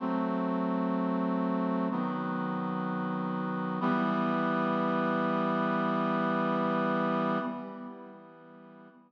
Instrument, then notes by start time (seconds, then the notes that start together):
brass section
0.00 F#3 A3 C4
1.91 D#3 F#3 B3
3.81 E3 G3 B3